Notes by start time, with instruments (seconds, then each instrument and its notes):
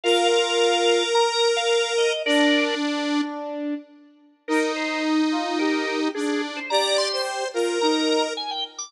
0.04 brass section F4, lead 1 (square) A#4, drawbar organ F5
0.31 drawbar organ F5
1.15 drawbar organ A#5
1.56 drawbar organ F5
1.98 drawbar organ D#5
2.26 lead 1 (square) D4, brass section D4, drawbar organ A#4 D5
2.81 brass section D4
4.48 lead 1 (square) D#4, brass section D#4, drawbar organ A#4
4.76 drawbar organ C5
5.32 brass section F4
5.59 brass section G4, drawbar organ A#4
5.87 drawbar organ A#4
6.14 lead 1 (square) D4, drawbar organ G#4
6.28 drawbar organ G#4
6.56 drawbar organ C5
6.70 brass section G4, lead 1 (square) D5, drawbar organ A#5
6.98 drawbar organ C6
7.12 lead 1 (square) C5
7.54 brass section F4, lead 1 (square) A#4
7.81 brass section D#4, drawbar organ A#5
8.09 drawbar organ A#5
8.37 drawbar organ G#5
8.51 drawbar organ G5
8.78 drawbar organ D6